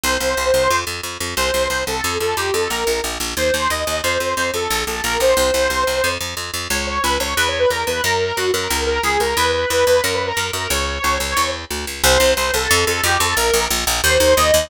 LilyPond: <<
  \new Staff \with { instrumentName = "Lead 2 (sawtooth)" } { \time 4/4 \key c \dorian \tempo 4 = 180 c''2~ c''8 r4. | c''4 c''8 a'4 a'8 g'8 a'8 | bes'4 r4 c''4 ees''4 | c''4 c''8 a'4 a'8 bes'8 c''8 |
c''2~ c''8 r4. | \key cis \dorian cis''8 cis''8 b'8 cis''8 \tuplet 3/2 { b'8 cis''8 b'8 } ais'8 b'8 | ais'4 fis'8 ais'4 ais'8 gis'8 ais'8 | b'8 b'8 b'8 b'8 \tuplet 3/2 { ais'8 b'8 ais'8 } ais'8 ais'8 |
cis''2. r4 | \key c \dorian c''4 c''8 a'4 a'8 g'8 a'8 | bes'4 r4 c''4 ees''4 | }
  \new Staff \with { instrumentName = "Electric Bass (finger)" } { \clef bass \time 4/4 \key c \dorian c,8 c,8 c,8 c,8 f,8 f,8 f,8 f,8 | c,8 c,8 c,8 c,8 f,8 f,8 f,8 f,8 | bes,,8 bes,,8 bes,,8 bes,,8 ees,8 ees,8 ees,8 ees,8 | f,8 f,8 f,8 f,8 bes,,8 bes,,8 bes,,8 bes,,8 |
c,8 c,8 c,8 c,8 f,8 f,8 f,8 f,8 | \key cis \dorian cis,4 cis,8 cis,8 e,4 e,8 e,8 | fis,4 fis,8 fis,8 cis,4 cis,8 cis,8 | e,4 e,8 e,8 fis,4 fis,8 fis,8 |
cis,4 cis,8 cis,8 e,4 d,8 cis,8 | \key c \dorian c,8 c,8 c,8 c,8 f,8 f,8 f,8 f,8 | bes,,8 bes,,8 bes,,8 bes,,8 ees,8 ees,8 ees,8 ees,8 | }
>>